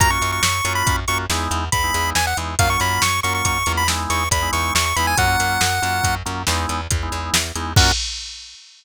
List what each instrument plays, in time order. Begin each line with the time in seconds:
0.00 electric bass (finger) F#2, drawbar organ A#3 C#4 F4 F#4, lead 1 (square) A#5, kick, closed hi-hat
0.10 drawbar organ A#3 C#4 F4 F#4, lead 1 (square) C#6
0.22 electric bass (finger) F#2, closed hi-hat
0.32 lead 1 (square) C#6
0.43 electric bass (finger) F#2, lead 1 (square) C#6, snare
0.65 electric bass (finger) F#2, drawbar organ A#3 C#4 F4 F#4, closed hi-hat
0.75 lead 1 (square) B5
0.87 electric bass (finger) F#2, kick, closed hi-hat
1.08 electric bass (finger) F#2, drawbar organ A#3 C#4 F4 F#4, lead 1 (square) C#6, closed hi-hat
1.30 electric bass (finger) E2, drawbar organ G#3 B3 D#4 E4, snare
1.51 electric bass (finger) E2, closed hi-hat
1.72 electric bass (finger) E2, lead 1 (square) B5, kick, closed hi-hat
1.84 drawbar organ G#3 B3 D#4 E4
1.94 electric bass (finger) E2, closed hi-hat
2.15 electric bass (finger) E2, lead 1 (square) G#5, snare
2.27 lead 1 (square) F#5
2.37 electric bass (finger) E2, drawbar organ G#3 B3 D#4 E4, closed hi-hat
2.59 electric bass (finger) F#2, drawbar organ F#3 A#3 C#4 F4, lead 1 (square) F5, kick, closed hi-hat
2.69 drawbar organ F#3 A#3 C#4 F4, lead 1 (square) C#6
2.80 electric bass (finger) F#2, lead 1 (square) B5, closed hi-hat
3.02 electric bass (finger) F#2, lead 1 (square) C#6, snare
3.23 electric bass (finger) F#2, drawbar organ F#3 A#3 C#4 F4, lead 1 (square) C#6, closed hi-hat
3.35 lead 1 (square) C#6
3.45 electric bass (finger) F#2, lead 1 (square) C#6, kick, closed hi-hat
3.66 electric bass (finger) E2, drawbar organ F#3 A#3 C#4 F4, closed hi-hat
3.77 lead 1 (square) B5
3.88 drawbar organ G#3 B3 D#4 E4, snare
4.10 electric bass (finger) E2, lead 1 (square) C#6, closed hi-hat
4.31 electric bass (finger) E2, lead 1 (square) B5, kick, closed hi-hat
4.42 drawbar organ G#3 B3 D#4 E4
4.53 electric bass (finger) E2, lead 1 (square) C#6, closed hi-hat
4.75 electric bass (finger) E2, lead 1 (square) C#6, snare
4.86 lead 1 (square) C#6
4.96 electric bass (finger) E2, drawbar organ G#3 B3 D#4 E4, lead 1 (square) B5, closed hi-hat
5.07 lead 1 (square) G#5
5.17 electric bass (finger) F#2, drawbar organ F#3 A#3 C#4 F4, lead 1 (square) F#5, kick, closed hi-hat
5.27 drawbar organ F#3 A#3 C#4 F4
5.40 electric bass (finger) F#2, closed hi-hat
5.61 electric bass (finger) F#2, snare
5.82 electric bass (finger) F#2, drawbar organ F#3 A#3 C#4 F4, closed hi-hat
6.04 electric bass (finger) F#2, kick, closed hi-hat
6.26 electric bass (finger) F#2, drawbar organ F#3 A#3 C#4 F4, closed hi-hat
6.47 electric bass (finger) E2, drawbar organ G#3 B3 D#4 E4, snare
6.69 electric bass (finger) E2, closed hi-hat
6.91 electric bass (finger) E2, kick, closed hi-hat
7.03 drawbar organ G#3 B3 D#4 E4
7.12 electric bass (finger) E2, closed hi-hat
7.34 electric bass (finger) E2, snare
7.55 electric bass (finger) E2, drawbar organ G#3 B3 D#4 E4, closed hi-hat
7.76 electric bass (finger) F#2, drawbar organ A#3 C#4 F4 F#4, lead 1 (square) F#5, kick, crash